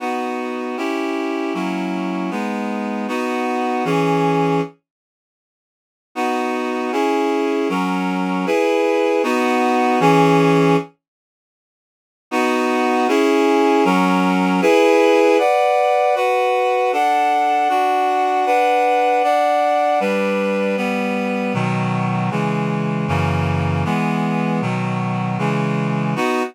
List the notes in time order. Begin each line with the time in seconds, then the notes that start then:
0.00 B3 D#4 F#4
0.77 C#4 E4 G4
1.54 F#3 A#3 C#4 E4
2.31 G#3 B3 D#4
3.08 B3 D#4 F#4
3.85 E3 C#4 G#4
6.15 B3 D#4 F#4
6.92 C#4 E4 G#4
7.69 F#3 C#4 A#4
8.46 E4 G#4 B4
9.23 B3 D#4 F#4
10.00 E3 C#4 G#4
12.31 B3 D#4 F#4
13.08 C#4 E4 G#4
13.85 F#3 C#4 A#4
14.61 E4 G#4 B4
15.39 B4 D5 F#5
16.15 F#4 B4 F#5
16.92 D4 A4 F#5
17.69 D4 F#4 F#5
18.46 D4 B4 F#5
19.23 D4 D5 F#5
20.00 G3 D4 B4
20.77 G3 B3 B4
21.54 B2 D#3 F#3
22.31 C#3 E3 G#3
23.08 F#2 C#3 E3 A#3
23.85 E3 G#3 B3
24.61 B2 D#3 F#3
25.38 C#3 E3 G#3
26.16 B3 D#4 F#4